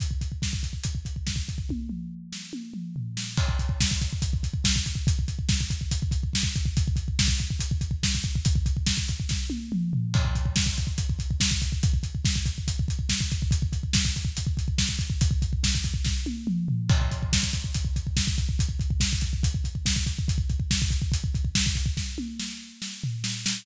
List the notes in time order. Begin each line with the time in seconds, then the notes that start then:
0.00 kick, closed hi-hat
0.11 kick
0.21 kick, closed hi-hat
0.32 kick
0.42 kick, snare
0.53 kick
0.63 kick, closed hi-hat
0.73 kick
0.84 kick, closed hi-hat
0.95 kick
1.05 kick, closed hi-hat
1.16 kick
1.27 kick, snare
1.36 kick
1.49 kick, closed hi-hat
1.58 kick
1.69 kick, high tom
1.89 mid tom
2.32 snare
2.53 high tom
2.74 mid tom
2.96 floor tom
3.17 snare
3.37 kick, crash
3.49 kick
3.59 kick, closed hi-hat
3.69 kick
3.81 kick, snare
3.91 kick
4.01 kick, closed hi-hat
4.13 kick
4.22 kick, closed hi-hat
4.33 kick
4.43 kick, closed hi-hat
4.54 kick
4.64 kick, snare
4.76 kick
4.86 kick, closed hi-hat
4.95 kick
5.07 kick, closed hi-hat
5.19 kick
5.28 kick, closed hi-hat
5.39 kick
5.49 kick, snare
5.61 kick
5.70 kick, closed hi-hat
5.81 kick
5.91 kick, closed hi-hat
6.02 kick
6.11 kick, closed hi-hat
6.23 kick
6.33 kick, snare
6.43 kick
6.56 kick, closed hi-hat
6.65 kick
6.77 kick, closed hi-hat
6.88 kick
6.96 kick, closed hi-hat
7.08 kick
7.19 kick, snare
7.28 kick
7.38 kick, closed hi-hat
7.50 kick
7.60 kick, closed hi-hat
7.71 kick
7.81 kick, closed hi-hat
7.91 kick
8.03 kick, snare
8.15 kick
8.23 kick, closed hi-hat
8.35 kick
8.45 kick, closed hi-hat
8.56 kick
8.66 kick, closed hi-hat
8.77 kick
8.86 kick, snare
8.98 kick
9.08 kick, closed hi-hat
9.20 kick
9.29 kick, snare
9.50 high tom
9.72 mid tom
9.93 floor tom
10.14 kick, crash
10.25 kick
10.35 kick, closed hi-hat
10.46 kick
10.56 kick, snare
10.66 kick
10.77 kick, closed hi-hat
10.87 kick
10.98 kick, closed hi-hat
11.10 kick
11.19 kick, closed hi-hat
11.31 kick
11.40 kick, snare
11.51 kick
11.62 kick, closed hi-hat
11.72 kick
11.83 kick, closed hi-hat
11.93 kick
12.03 kick, closed hi-hat
12.15 kick
12.25 kick, snare
12.36 kick
12.46 kick, closed hi-hat
12.58 kick
12.68 kick, closed hi-hat
12.79 kick
12.88 kick, closed hi-hat
12.99 kick
13.09 kick, snare
13.21 kick
13.31 kick, closed hi-hat
13.42 kick
13.51 kick, closed hi-hat
13.62 kick
13.73 kick, closed hi-hat
13.83 kick
13.93 kick, snare
14.05 kick
14.16 kick, closed hi-hat
14.25 kick
14.37 kick, closed hi-hat
14.47 kick
14.57 kick, closed hi-hat
14.68 kick
14.78 kick, snare
14.89 kick
14.99 kick, closed hi-hat
15.10 kick
15.21 kick, closed hi-hat
15.31 kick
15.42 kick, closed hi-hat
15.53 kick
15.63 kick, snare
15.75 kick
15.84 kick, closed hi-hat
15.94 kick
16.04 kick, snare
16.26 high tom
16.47 mid tom
16.68 floor tom
16.89 kick, crash
17.01 kick
17.11 kick, closed hi-hat
17.23 kick
17.33 kick, snare
17.43 kick
17.53 kick, closed hi-hat
17.64 kick
17.74 kick, closed hi-hat
17.85 kick
17.96 kick, closed hi-hat
18.07 kick
18.17 kick, snare
18.27 kick
18.38 kick, closed hi-hat
18.49 kick
18.59 kick, closed hi-hat
18.69 kick
18.79 kick, closed hi-hat
18.90 kick
19.00 kick, snare
19.13 kick
19.21 kick, closed hi-hat
19.33 kick
19.43 kick, closed hi-hat
19.54 kick
19.64 kick, closed hi-hat
19.75 kick
19.86 kick, snare
19.96 kick
20.07 kick, closed hi-hat
20.19 kick
20.28 kick, closed hi-hat
20.38 kick
20.49 kick, closed hi-hat
20.60 kick
20.71 kick, snare
20.82 kick
20.90 kick, closed hi-hat
21.02 kick
21.12 kick, closed hi-hat
21.24 kick
21.35 kick, closed hi-hat
21.45 kick
21.55 kick, snare
21.66 kick
21.75 kick, closed hi-hat
21.86 kick
21.97 kick, snare
22.18 high tom
22.40 snare
22.82 snare
23.04 floor tom
23.24 snare
23.46 snare